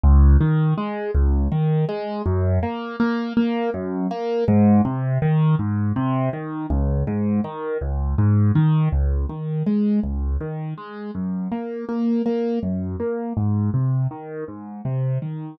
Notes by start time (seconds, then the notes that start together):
0.04 C#2
0.41 D#3
0.78 G#3
1.15 C#2
1.52 D#3
1.89 G#3
2.26 F#2
2.63 A#3
3.00 A#3
3.37 A#3
3.74 F#2
4.11 A#3
4.48 G#2
4.85 C3
5.22 D#3
5.59 G#2
5.96 C3
6.33 D#3
6.70 C#2
7.07 G#2
7.44 D#3
7.81 C#2
8.18 G#2
8.55 D#3
8.92 C#2
9.29 D#3
9.67 G#3
10.04 C#2
10.41 D#3
10.78 G#3
11.15 F#2
11.52 A#3
11.89 A#3
12.26 A#3
12.63 F#2
13.00 A#3
13.37 G#2
13.74 C3
14.11 D#3
14.48 G#2
14.85 C3
15.22 D#3